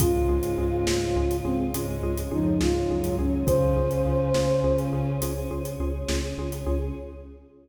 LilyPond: <<
  \new Staff \with { instrumentName = "Flute" } { \time 12/8 \key des \major \tempo 4. = 69 f'2~ f'8 c'8 r4 ees'8 f'4 des'8 | c''2~ c''8 r2. r8 | }
  \new Staff \with { instrumentName = "Ocarina" } { \time 12/8 \key des \major <aes, aes>2~ <aes, aes>8 r8 <aes, aes>4 <f, f>8 <aes, aes>8 <ges, ges>4 | <des des'>2. r2. | }
  \new Staff \with { instrumentName = "Xylophone" } { \time 12/8 \key des \major <des' f' aes'>8 <des' f' aes'>8 <des' f' aes'>8 <des' f' aes'>8 <des' f' aes'>8 <des' f' aes'>8 <des' f' aes'>8 <des' f' aes'>8 <des' f' aes'>8 <des' f' aes'>8 <des' f' aes'>8 <des' f' aes'>8 | <des' f' aes'>8 <des' f' aes'>8 <des' f' aes'>8 <des' f' aes'>8 <des' f' aes'>8 <des' f' aes'>8 <des' f' aes'>8 <des' f' aes'>8 <des' f' aes'>8 <des' f' aes'>8 <des' f' aes'>8 <des' f' aes'>8 | }
  \new Staff \with { instrumentName = "Synth Bass 2" } { \clef bass \time 12/8 \key des \major des,8 des,8 des,8 des,8 des,8 des,8 des,8 des,8 des,8 des,8 des,8 des,8 | des,8 des,8 des,8 des,8 des,8 des,8 des,8 des,8 des,8 des,8 des,8 des,8 | }
  \new Staff \with { instrumentName = "Choir Aahs" } { \time 12/8 \key des \major <des' f' aes'>2. <des' aes' des''>2. | <des' f' aes'>2. <des' aes' des''>2. | }
  \new DrumStaff \with { instrumentName = "Drums" } \drummode { \time 12/8 <hh bd>8. hh8. sn8. hh8. hh8. hh8. sn8. hh8. | <hh bd>8. hh8. sn8. hh8. hh8. hh8. sn8. hh8. | }
>>